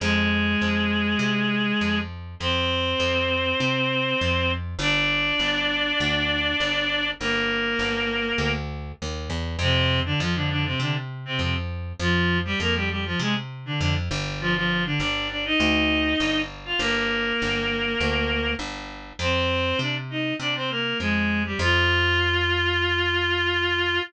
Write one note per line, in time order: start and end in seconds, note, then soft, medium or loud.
0.00 0.55 F2 medium
0.00 1.99 G#3 medium
0.00 1.99 G#4 medium
0.61 1.15 F2 medium
1.19 1.73 C3 medium
1.81 2.35 F2 medium
2.40 2.94 F2 medium
2.40 4.51 C4 medium
2.40 4.51 C5 medium
3.00 3.54 F2 medium
3.60 4.14 C3 medium
4.21 4.75 F2 medium
4.79 5.33 G1 medium
4.79 7.08 D4 medium
4.79 7.08 D5 medium
5.39 5.93 G1 medium
6.00 6.54 D2 medium
6.60 7.14 G1 medium
7.20 7.75 G1 medium
7.20 8.52 A#3 medium
7.20 8.52 A#4 medium
7.79 8.33 G1 medium
8.38 8.92 D2 medium
9.02 9.29 D#2 medium
9.30 9.57 E2 medium
9.59 10.13 F2 medium
9.59 10.00 C3 medium
9.59 10.00 C4 medium
10.05 10.19 D3 medium
10.05 10.19 D4 medium
10.20 10.74 F2 medium
10.20 10.34 F3 medium
10.20 10.34 F4 medium
10.35 10.49 D3 medium
10.35 10.49 D4 medium
10.50 10.64 D3 medium
10.50 10.64 D4 medium
10.65 10.79 C3 medium
10.65 10.79 C4 medium
10.80 11.34 C3 medium
10.80 10.94 D3 medium
10.80 10.94 D4 medium
11.25 11.39 C3 medium
11.25 11.39 C4 medium
11.39 11.93 F2 medium
11.39 11.54 C3 soft
11.39 11.54 C4 medium
11.99 12.54 F2 medium
11.99 12.38 F3 medium
11.99 12.38 F4 medium
12.45 12.59 G3 medium
12.45 12.59 G4 medium
12.60 13.14 F2 medium
12.60 12.74 A#3 medium
12.60 12.74 A#4 medium
12.75 12.89 G3 medium
12.75 12.89 G4 medium
12.90 13.04 G3 soft
12.90 13.04 G4 medium
13.05 13.19 F3 medium
13.05 13.19 F4 medium
13.19 13.73 C3 medium
13.19 13.34 G#3 medium
13.19 13.34 G#4 medium
13.66 13.79 D3 medium
13.66 13.79 D4 medium
13.80 14.09 F2 medium
13.80 13.94 D3 medium
13.80 13.94 D4 medium
14.11 14.95 G1 medium
14.40 14.54 F3 medium
14.40 14.54 F4 medium
14.55 14.83 F3 medium
14.55 14.83 F4 medium
14.85 14.99 D3 medium
14.85 14.99 D4 medium
15.00 15.54 G1 medium
15.00 15.28 D4 medium
15.00 15.28 D5 medium
15.30 15.44 D4 soft
15.30 15.44 D5 medium
15.45 16.40 D#4 medium
15.45 16.40 D#5 medium
15.60 16.14 D2 medium
16.20 16.74 G1 medium
16.65 16.79 F4 medium
16.65 16.79 F5 medium
16.79 17.33 G1 medium
16.79 18.52 A#3 medium
16.79 18.52 A#4 medium
17.42 17.96 G1 medium
18.00 18.55 D2 medium
18.59 19.13 G1 medium
19.19 19.73 F2 medium
19.19 19.78 C4 medium
19.19 19.78 C5 medium
19.79 20.33 C3 medium
19.79 19.95 D4 medium
19.79 19.95 D5 medium
20.10 20.34 D#4 soft
20.10 20.34 D#5 medium
20.39 20.93 C3 medium
20.39 20.54 D4 medium
20.39 20.54 D5 medium
20.55 20.69 C4 medium
20.55 20.69 C5 medium
20.70 20.98 A#3 medium
20.70 20.98 A#4 medium
21.00 21.54 F2 medium
21.00 21.42 G#3 medium
21.00 21.42 G#4 medium
21.45 21.59 G3 medium
21.45 21.59 G4 medium
21.59 23.99 F2 medium
21.59 24.00 F4 loud